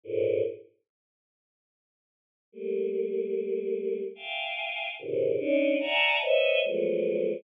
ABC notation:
X:1
M:6/8
L:1/8
Q:3/8=49
K:none
V:1 name="Choir Aahs"
[^G,,A,,^A,,] z5 | [G,A,^A,]4 [efg^g]2 | [^G,,^A,,B,,C,^C,^D,] [^C=D^D] [=de^f^g=a^a] [B=c^c^de] [=F,^F,^G,=A,B,]2 |]